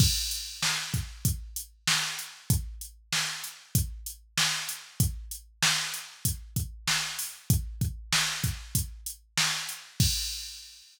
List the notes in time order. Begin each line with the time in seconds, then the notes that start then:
0.00 kick, crash
0.31 closed hi-hat
0.62 snare
0.94 kick, closed hi-hat
1.25 kick, closed hi-hat
1.56 closed hi-hat
1.88 snare
2.19 closed hi-hat
2.50 kick, closed hi-hat
2.81 closed hi-hat
3.12 snare
3.44 closed hi-hat
3.75 kick, closed hi-hat
4.06 closed hi-hat
4.38 snare
4.69 closed hi-hat
5.00 kick, closed hi-hat
5.31 closed hi-hat
5.62 snare
5.94 closed hi-hat
6.25 kick, closed hi-hat
6.56 kick, closed hi-hat
6.88 snare
7.19 open hi-hat
7.50 kick, closed hi-hat
7.81 kick, closed hi-hat
8.12 snare
8.44 kick, closed hi-hat
8.75 kick, closed hi-hat
9.06 closed hi-hat
9.38 snare
9.69 closed hi-hat
10.00 kick, crash